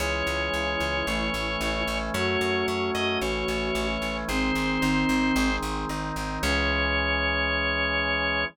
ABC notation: X:1
M:2/2
L:1/8
Q:1/2=56
K:C#m
V:1 name="Drawbar Organ"
c8 | c2 c d c4 | ^B5 z3 | c8 |]
V:2 name="Flute"
E8 | F8 | ^B,5 z3 | C8 |]
V:3 name="Drawbar Organ"
[E,G,C]4 [E,A,C]4 | [F,A,C]4 [E,A,C]4 | [D,G,^B,]2 [D,B,D]2 [D,G,B,]2 [D,B,D]2 | [E,G,C]8 |]
V:4 name="Electric Bass (finger)" clef=bass
C,, C,, C,, C,, A,,, A,,, A,,, A,,, | F,, F,, F,, F,, A,,, A,,, A,,, A,,, | G,,, G,,, G,,, G,,, G,,, G,,, G,,, G,,, | C,,8 |]